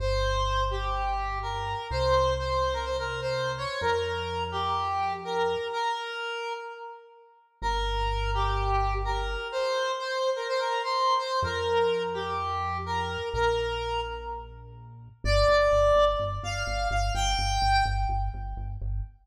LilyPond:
<<
  \new Staff \with { instrumentName = "Lead 1 (square)" } { \time 4/4 \key g \minor \tempo 4 = 126 c''4. g'4. bes'4 | c''4 c''8. bes'16 c''16 bes'8 c''8. des''8 | bes'4. g'4. bes'4 | bes'2 r2 |
bes'4. g'4. bes'4 | c''4 c''8. bes'16 c''16 bes'8 c''8. c''8 | bes'4. g'4. bes'4 | bes'4. r2 r8 |
d''2 r8 f''4 f''8 | g''4. r2 r8 | }
  \new Staff \with { instrumentName = "Synth Bass 1" } { \clef bass \time 4/4 \key g \minor g,,1 | c,1 | f,1 | r1 |
g,,1 | r1 | f,1 | bes,,1 |
g,,8 g,,8 g,,8 g,,8 g,,8 g,,8 g,,8 g,,8 | g,,8 g,,8 g,,8 g,,8 g,,8 g,,8 g,,8 g,,8 | }
>>